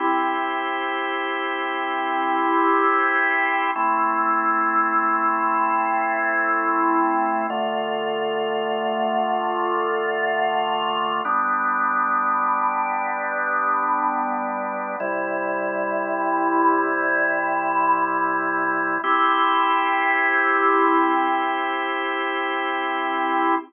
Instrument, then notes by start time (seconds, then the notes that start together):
drawbar organ
0.00 C4 E4 G4
3.76 A3 C4 E4
7.50 D3 A3 F4
11.25 G3 B3 D4
15.00 C3 G3 E4
19.04 C4 E4 G4